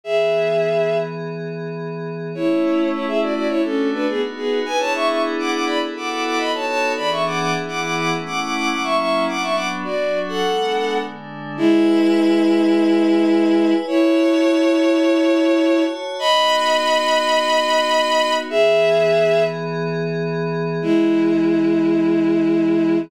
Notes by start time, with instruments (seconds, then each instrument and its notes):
0.04 pad 5 (bowed) E3 B3 G#4, violin G#4 E5
2.34 pad 5 (bowed) A3 C#4 E4, violin E4 C#5
2.92 violin E4 C#5
3.06 violin G#4 E5
3.21 violin F#4 D5
3.34 violin F#4 D5
3.48 pad 5 (bowed) A3 D4 F#4, violin E4 C#5
3.64 violin C#4 A4
3.92 violin D4 B4
4.07 pad 5 (bowed) B3 D#4 F#4, violin B3 G#4
4.36 violin B3 G#4
4.65 pad 5 (bowed) B3 D4 E4 G#4, violin B4 G#5
4.79 violin C#5 A5
4.94 violin E5 C#6
5.08 violin E5 C#6
5.39 violin F#5 D6
5.51 violin F#5 D6
5.65 violin D5 B5
5.81 pad 5 (bowed) B3 E4 F#4 A4
5.96 violin F#5 D6
6.09 violin F#5 D6
6.24 violin F#5 D6
6.38 pad 5 (bowed) B3 D#4 F#4 A4, violin D#5 B5
6.54 violin C#5 A5
6.66 violin C#5 A5
6.96 pad 5 (bowed) E3 B3 D4 G#4, violin D5 B5
7.10 violin E5 C#6
7.26 violin F#5 D6
7.39 violin F#5 D6
7.54 pad 5 (bowed) E3 B3 E4 G#4
7.68 violin F#5 D6
7.81 violin F#5 D6
7.96 violin F#5 D6
8.11 pad 5 (bowed) A3 C#4 E4
8.26 violin F#5 D6
8.41 violin F#5 D6
8.55 violin F#5 D6
8.69 pad 5 (bowed) F#3 A#3 C#4 E4, violin F#5 D6
8.83 violin E5 C#6
8.98 violin E5 C#6
9.27 pad 5 (bowed) F#3 B3 D4, violin F#5 D6
9.42 violin E5 C#6
9.54 violin F#5 D6
9.84 pad 5 (bowed) F#3 D4 F#4, violin F#4 D5
10.28 violin A4 F#5
10.42 pad 5 (bowed) G#3 B3 D4
11.00 pad 5 (bowed) D3 G#3 D4
11.57 violin G#3 E4, pad 5 (bowed) E4 B4 G#5
13.87 violin E4 C#5, pad 5 (bowed) F#4 C#5 A5
16.19 pad 5 (bowed) B3 D#4 F#4, violin D#5 B5
18.50 pad 5 (bowed) E3 B3 G#4, violin G#4 E5
20.80 pad 5 (bowed) E3 B3 G#4, violin G#3 E4